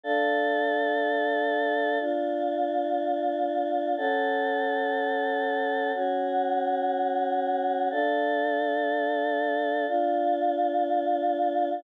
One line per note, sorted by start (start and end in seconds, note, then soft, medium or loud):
0.03 1.98 D4 medium
0.03 1.98 A4 loud
0.03 1.98 F5 medium
2.00 3.95 D4 medium
2.00 3.95 F4 medium
2.00 3.95 F5 loud
3.97 5.92 C#4 medium
3.97 5.92 A4 medium
3.97 5.92 F#5 medium
5.94 7.89 C#4 medium
5.94 7.89 F#4 medium
5.94 7.89 F#5 medium
7.91 9.85 D4 medium
7.91 9.85 A4 medium
7.91 9.85 F5 medium
9.87 11.82 D4 medium
9.87 11.82 F4 medium
9.87 11.82 F5 medium